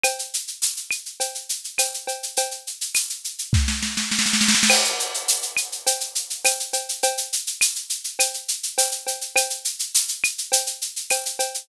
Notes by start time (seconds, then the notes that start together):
0.04 cowbell, claves, shaker
0.19 shaker
0.34 shaker
0.47 shaker
0.62 tambourine, shaker
0.77 shaker
0.91 claves, shaker
1.06 shaker
1.20 cowbell, shaker
1.35 shaker
1.49 shaker
1.64 shaker
1.78 tambourine, cowbell, claves, shaker
1.94 shaker
2.07 cowbell, shaker
2.23 shaker
2.37 cowbell, shaker
2.51 shaker
2.67 shaker
2.81 shaker
2.95 tambourine, claves, shaker
3.09 shaker
3.24 shaker
3.38 shaker
3.53 kick, snare
3.68 snare
3.83 snare
3.97 snare
4.11 snare
4.19 snare
4.26 snare
4.33 snare
4.41 snare
4.48 snare
4.55 snare
4.63 snare
4.70 crash, cowbell, claves
4.84 shaker
5.00 shaker
5.14 shaker
5.28 tambourine, shaker
5.42 shaker
5.57 claves, shaker
5.72 shaker
5.87 cowbell, shaker
6.00 shaker
6.15 shaker
6.30 shaker
6.45 tambourine, cowbell, claves, shaker
6.60 shaker
6.73 cowbell, shaker
6.89 shaker
7.03 cowbell, shaker
7.17 shaker
7.33 shaker
7.47 shaker
7.61 tambourine, claves, shaker
7.75 shaker
7.90 shaker
8.04 shaker
8.19 cowbell, claves, shaker
8.34 shaker
8.48 shaker
8.63 shaker
8.78 tambourine, cowbell, shaker
8.92 shaker
9.07 cowbell, shaker
9.21 shaker
9.36 cowbell, claves, shaker
9.50 shaker
9.65 shaker
9.79 shaker
9.95 tambourine, shaker
10.08 shaker
10.24 claves, shaker
10.38 shaker
10.52 cowbell, shaker
10.66 shaker
10.81 shaker
10.96 shaker
11.10 tambourine, cowbell, claves, shaker
11.25 shaker
11.39 cowbell, shaker
11.54 shaker